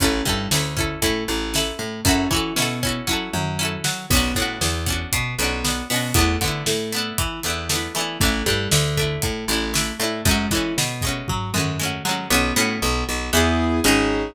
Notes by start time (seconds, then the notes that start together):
0.00 A1 C#4 E4, kick, closed hi-hat
0.04 A4
0.25 G2 G3 C#4 E4, kick
0.29 A4
0.51 D2 D3 C#4 E4, snare
0.56 A4
0.77 C#4 E4 A4, kick
1.02 A2 A3 C#4 E4 A4, kick, closed hi-hat
1.28 A1 A3
1.54 C#4 E4 A4, snare
1.79 A2 A3
2.05 F#2 C#4 E4 F#4, kick, closed hi-hat
2.11 A4
2.31 E3 C#4 E4 F#4, kick
2.36 A4
2.56 B2 B3 C#4 E4, snare
2.60 F#4 A4
2.83 C#4 E4 F#4, kick
2.89 A4
3.07 F#3 C#4 E4 F#4, kick
3.13 A4
3.33 F#2 F#3, mid tom
3.59 C#4 E4 F#4
3.65 A4
3.84 F#3 F#4, snare
4.10 B1 B3 C#4, kick, crash
4.15 D4 F#4
4.35 A2 A3 B3 C#4, kick, closed hi-hat
4.40 D4 F#4
4.61 E2 E3, snare
4.86 B3 C#4 D4, kick, closed hi-hat
4.92 F#4
5.12 B2 B3, kick, closed hi-hat
5.38 B1 B3 C#4, closed hi-hat
5.42 D4 F#4
5.64 B3 C#4 D4, snare
5.70 F#4
5.90 B2 B3 C#4 D4, open hi-hat
5.96 F#4
6.14 E2 A3 B3, kick, closed hi-hat
6.19 D4 E4
6.41 D3 A3 B3 D4, kick, closed hi-hat
6.46 D4 E4
6.66 A2 A3, snare
6.93 A3 B3 D4, closed hi-hat
6.98 E4
7.18 E3 E4, kick, closed hi-hat
7.43 E2 E3 A3 B3, closed hi-hat
7.48 D4 E4
7.69 A3 B3, snare
7.74 D4 E4
7.95 E3 A3 B3 D4 E4, closed hi-hat
8.01 E4
8.20 A1 A3 D4, kick, closed hi-hat
8.25 E4
8.46 G2 G3 A3 D4 E4, kick, closed hi-hat
8.71 D2 D3, snare
8.97 A3 D4, kick, closed hi-hat
9.01 E4
9.22 A2 A3, kick, closed hi-hat
9.48 A1 A3 D4, closed hi-hat
9.53 E4
9.74 A3 D4 E4, snare
9.99 A2 A3 D4, closed hi-hat
10.04 E4
10.25 F#2 G#3 A3 C#4, kick, closed hi-hat
10.31 F#4
10.51 E3 G#3 A3 E4, kick, closed hi-hat
10.55 C#4 F#4
10.77 B2 B3, snare
11.01 G#3 A3, kick, closed hi-hat
11.07 C#4 F#4
11.28 F#3 F#4, kick, floor tom
11.54 F#2 F#3 G#3 A3 C#4, mid tom
11.60 F#4
11.79 G#3 A3 C#4
11.85 F#4
12.05 F#3 G#3 A3 F#4
12.09 C#4 F#4
12.30 B1 B3 C#4 F#4
12.56 A2 A3 B3 C#4 F#4
12.82 B1 B3
13.08 B1 B3
13.33 E2 B3 E4 G#4
13.84 G#1 C#4 D#4 G#4